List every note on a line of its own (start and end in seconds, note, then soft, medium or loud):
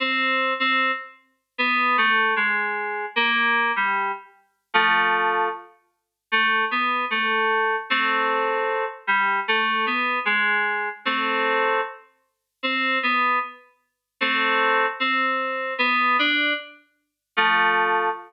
0.00 0.53 C4 loud
0.60 0.91 C4 loud
1.58 1.97 B3 loud
1.98 2.34 A3 loud
2.36 3.06 G#3 loud
3.16 3.72 A#3 loud
3.76 4.12 G3 medium
4.74 5.49 F3 loud
4.74 5.49 A3 loud
6.32 6.65 A3 loud
6.71 7.05 B3 loud
7.10 7.76 A3 loud
7.90 8.85 A3 medium
7.90 8.85 C4 loud
9.07 9.40 G3 loud
9.48 9.85 A3 loud
9.86 10.19 B3 medium
10.25 10.89 G#3 loud
11.05 11.80 A3 loud
11.05 11.80 C4 loud
12.63 12.98 C4 loud
13.03 13.39 B3 loud
14.21 14.86 A3 loud
14.21 14.86 C4 loud
15.00 15.74 C4 loud
15.78 16.17 B3 loud
16.19 16.53 D4 loud
17.37 18.09 F3 loud
17.37 18.09 A3 loud